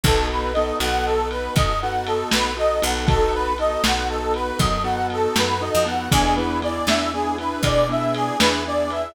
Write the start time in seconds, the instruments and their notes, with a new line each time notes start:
0.03 electric bass (finger) B1, acoustic grand piano B3 D#4 F#4 A4, harmonica A4, kick, ride
0.30 harmonica B4
0.53 acoustic grand piano B3 D#4 F#4 A4, harmonica D#5, ride
0.80 electric bass (finger) B1, acoustic grand piano B3 D#4 F#4 A4, harmonica F#5, ride
1.05 harmonica A4
1.30 harmonica B4, ride
1.56 electric bass (finger) F#2, harmonica D#5, kick, ride
1.82 acoustic grand piano B3 D#4 F#4 A4, harmonica F#5
2.06 harmonica A4, ride
2.31 electric bass (finger) B1, harmonica B4, snare
2.57 acoustic grand piano B3 D#4 F#4 A4, harmonica D#5
2.82 electric bass (finger) B1, acoustic grand piano B3 D#4 F#4 A4, harmonica F#5, ride
3.07 acoustic grand piano B3 D#4 F#4 A4, harmonica A4, kick, ride
3.34 harmonica B4
3.58 acoustic grand piano B3 D#4 F#4 A4, harmonica D#5, ride
3.84 electric bass (finger) B1, acoustic grand piano B3 D#4 F#4 A4, harmonica F#5, snare
4.09 harmonica A4
4.34 harmonica B4, ride
4.59 electric bass (finger) F#2, harmonica D#5, kick, ride
4.84 acoustic grand piano B3 D#4 F#4 A4, harmonica F#5
5.10 harmonica A4, ride
5.36 electric bass (finger) F#2, harmonica B4, snare
5.61 acoustic grand piano B3 D#4 F#4 A4, harmonica D#5
5.75 electric bass (finger) F2
5.85 acoustic grand piano B3 D#4 F#4 A4, harmonica F#5, ride
6.11 electric bass (finger) E2, acoustic grand piano B3 D4 E4 G#4, harmonica G#4, kick, ride
6.36 acoustic grand piano B3 D4 E4 G#4, harmonica B4
6.62 acoustic grand piano B3 D4 E4 G#4, harmonica D5, ride
6.87 electric bass (finger) E2, acoustic grand piano B3 D4 E4 G#4, harmonica E5, snare
7.13 acoustic grand piano B3 D4 E4 G#4, harmonica G#4
7.38 acoustic grand piano B3 D4 E4 G#4, harmonica B4, ride
7.63 electric bass (finger) B2, harmonica D5, kick, ride
7.89 acoustic grand piano B3 D4 E4 G#4, harmonica E5
8.14 harmonica G#4, ride
8.39 electric bass (finger) E2, acoustic grand piano B3 D4 E4 G#4, harmonica B4, snare
8.65 acoustic grand piano B3 D4 E4 G#4, harmonica D5
8.90 acoustic grand piano B3 D4 E4 G#4, harmonica E5, ride